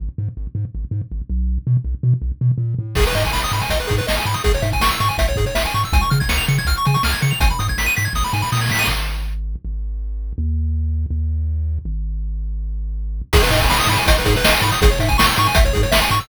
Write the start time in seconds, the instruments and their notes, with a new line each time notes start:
0.00 synth bass 1 G#1
0.18 synth bass 1 G#2
0.37 synth bass 1 G#1
0.55 synth bass 1 G#2
0.75 synth bass 1 G#1
0.91 synth bass 1 G#2
1.11 synth bass 1 G#1
1.30 synth bass 1 B1
1.67 synth bass 1 B2
1.84 synth bass 1 B1
2.03 synth bass 1 B2
2.22 synth bass 1 B1
2.41 synth bass 1 B2
2.58 synth bass 1 A#2
2.79 synth bass 1 A2
2.95 synth bass 1 G#1, lead 1 (square) G#4, kick, crash
3.06 lead 1 (square) B4, closed hi-hat
3.15 synth bass 1 G#2, lead 1 (square) D#5, closed hi-hat
3.24 lead 1 (square) G#5, kick, closed hi-hat
3.33 synth bass 1 G#1, lead 1 (square) B5, snare
3.43 lead 1 (square) D#6, closed hi-hat
3.52 synth bass 1 G#2, lead 1 (square) B5, closed hi-hat
3.61 lead 1 (square) G#5, closed hi-hat
3.70 synth bass 1 G#1, lead 1 (square) D#5, kick, closed hi-hat
3.79 lead 1 (square) B4, closed hi-hat
3.87 synth bass 1 G#2, lead 1 (square) G#4, kick, closed hi-hat
3.98 lead 1 (square) B4, closed hi-hat
4.07 synth bass 1 G#1, lead 1 (square) D#5, snare
4.17 lead 1 (square) G#5, closed hi-hat
4.25 synth bass 1 G#2, lead 1 (square) B5, closed hi-hat
4.34 lead 1 (square) D#6, closed hi-hat
4.44 synth bass 1 G#1, lead 1 (square) G#4, kick, closed hi-hat
4.54 lead 1 (square) C#5, closed hi-hat
4.62 synth bass 1 G#2, lead 1 (square) E5, closed hi-hat
4.72 lead 1 (square) G#5, kick, closed hi-hat
4.80 synth bass 1 G#1, lead 1 (square) C#6, snare
4.91 lead 1 (square) E6, closed hi-hat
5.00 synth bass 1 G#2, lead 1 (square) C#6, closed hi-hat
5.09 lead 1 (square) G#5, closed hi-hat
5.18 synth bass 1 G#1, lead 1 (square) E5, kick, closed hi-hat
5.27 lead 1 (square) C#5, kick, closed hi-hat
5.36 synth bass 1 G#2, lead 1 (square) G#4, kick, closed hi-hat
5.46 lead 1 (square) C#5, closed hi-hat
5.55 synth bass 1 G#1, lead 1 (square) E5, snare
5.65 lead 1 (square) G#5, closed hi-hat
5.74 synth bass 1 G#2, lead 1 (square) C#6, closed hi-hat
5.83 lead 1 (square) E6, closed hi-hat
5.93 synth bass 1 C#2, lead 1 (square) G#5, kick, closed hi-hat
6.01 lead 1 (square) C#6, closed hi-hat
6.10 synth bass 1 C#3, lead 1 (square) F6, closed hi-hat
6.20 lead 1 (square) G#6, kick, closed hi-hat
6.29 synth bass 1 C#2, lead 1 (square) C#7, snare
6.37 lead 1 (square) F7, closed hi-hat
6.48 synth bass 1 C#3, lead 1 (square) C#7, closed hi-hat
6.58 lead 1 (square) G#6, closed hi-hat
6.65 synth bass 1 C#2, lead 1 (square) F6, kick, closed hi-hat
6.76 lead 1 (square) C#6, closed hi-hat
6.85 synth bass 1 C#3, lead 1 (square) G#5, closed hi-hat
6.94 lead 1 (square) C#6, closed hi-hat
7.03 synth bass 1 C#2, lead 1 (square) F6, snare
7.13 lead 1 (square) G#6, closed hi-hat
7.21 synth bass 1 C#3, lead 1 (square) C#7, closed hi-hat
7.31 lead 1 (square) F7, closed hi-hat
7.40 synth bass 1 G#1, lead 1 (square) G#5, kick, closed hi-hat
7.50 lead 1 (square) B5, closed hi-hat
7.59 synth bass 1 G#2, lead 1 (square) D#6, closed hi-hat
7.68 lead 1 (square) G#6, kick, closed hi-hat
7.78 synth bass 1 G#1, lead 1 (square) B6, snare
7.86 lead 1 (square) D#7, closed hi-hat
7.96 synth bass 1 G#2, lead 1 (square) B6, closed hi-hat
8.05 lead 1 (square) G#6, closed hi-hat
8.13 synth bass 1 G#1, lead 1 (square) D#6, kick, snare
8.24 lead 1 (square) B5, snare
8.33 synth bass 1 G#2, lead 1 (square) G#5, snare
8.42 lead 1 (square) B5, snare
8.52 synth bass 1 A#2, lead 1 (square) D#6, snare
8.56 snare
8.61 lead 1 (square) G#6, snare
8.66 snare
8.69 synth bass 1 A2, lead 1 (square) B6, snare
8.74 snare
8.79 lead 1 (square) D#7, snare
8.84 synth bass 1 G#1, snare
9.65 synth bass 1 G#1
10.38 synth bass 1 D#2
11.10 synth bass 1 D#2
11.85 synth bass 1 G#1
13.33 synth bass 1 G#1, lead 1 (square) G#4, kick, crash
13.42 lead 1 (square) B4, closed hi-hat
13.51 synth bass 1 G#2, lead 1 (square) D#5, closed hi-hat
13.61 lead 1 (square) G#5, kick, closed hi-hat
13.70 synth bass 1 G#1, lead 1 (square) B5, snare
13.80 lead 1 (square) D#6, closed hi-hat
13.87 synth bass 1 G#2, lead 1 (square) B5, closed hi-hat
13.98 lead 1 (square) G#5, closed hi-hat
14.06 synth bass 1 G#1, lead 1 (square) D#5, kick, closed hi-hat
14.16 lead 1 (square) B4, closed hi-hat
14.25 synth bass 1 G#2, lead 1 (square) G#4, kick, closed hi-hat
14.36 lead 1 (square) B4, closed hi-hat
14.44 synth bass 1 G#1, lead 1 (square) D#5, snare
14.52 lead 1 (square) G#5, closed hi-hat
14.62 synth bass 1 G#2, lead 1 (square) B5, closed hi-hat
14.72 lead 1 (square) D#6, closed hi-hat
14.82 synth bass 1 G#1, lead 1 (square) G#4, kick, closed hi-hat
14.90 lead 1 (square) C#5, closed hi-hat
14.99 synth bass 1 G#2, lead 1 (square) E5, closed hi-hat
15.08 lead 1 (square) G#5, kick, closed hi-hat
15.18 synth bass 1 G#1, lead 1 (square) C#6, snare
15.27 lead 1 (square) E6, closed hi-hat
15.36 synth bass 1 G#2, lead 1 (square) C#6, closed hi-hat
15.46 lead 1 (square) G#5, closed hi-hat
15.55 synth bass 1 G#1, lead 1 (square) E5, kick, closed hi-hat
15.65 lead 1 (square) C#5, kick, closed hi-hat
15.73 synth bass 1 G#2, lead 1 (square) G#4, kick, closed hi-hat
15.83 lead 1 (square) C#5, closed hi-hat
15.92 synth bass 1 G#1, lead 1 (square) E5, snare
16.02 lead 1 (square) G#5, closed hi-hat
16.10 synth bass 1 G#2, lead 1 (square) C#6, closed hi-hat
16.20 lead 1 (square) E6, closed hi-hat